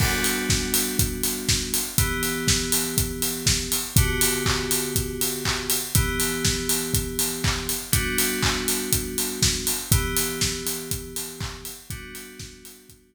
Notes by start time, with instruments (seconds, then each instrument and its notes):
0.00 electric piano 2 G3 B3 D4 F#4, kick, crash
0.24 open hi-hat
0.50 kick, snare
0.74 open hi-hat
0.99 kick, closed hi-hat
1.23 open hi-hat
1.49 kick, snare
1.74 open hi-hat
1.98 electric piano 2 E3 B3 G4, kick, closed hi-hat
2.23 open hi-hat
2.48 kick, snare
2.72 open hi-hat
2.98 kick, closed hi-hat
3.22 open hi-hat
3.46 kick, snare
3.72 open hi-hat
3.96 electric piano 2 D3 B3 F#4 G4, kick, closed hi-hat
4.21 open hi-hat
4.46 kick, clap
4.71 open hi-hat
4.96 kick, closed hi-hat
5.21 open hi-hat
5.45 kick, clap
5.70 open hi-hat
5.95 electric piano 2 E3 B3 G4, kick, closed hi-hat
6.20 open hi-hat
6.45 kick, snare
6.69 open hi-hat
6.94 kick, closed hi-hat
7.19 open hi-hat
7.44 kick, clap
7.69 open hi-hat
7.92 electric piano 2 G3 B3 D4 F#4, kick, closed hi-hat
8.18 open hi-hat
8.42 kick, clap
8.68 open hi-hat
8.93 kick, closed hi-hat
9.18 open hi-hat
9.42 kick, snare
9.67 open hi-hat
9.92 electric piano 2 E3 B3 G4, kick, closed hi-hat
10.17 open hi-hat
10.41 kick, snare
10.67 open hi-hat
10.91 kick, closed hi-hat
11.16 open hi-hat
11.40 kick, clap
11.65 open hi-hat
11.90 electric piano 2 G3 B3 D4 F#4, kick, closed hi-hat
12.15 open hi-hat
12.39 kick, snare
12.65 open hi-hat
12.89 kick, closed hi-hat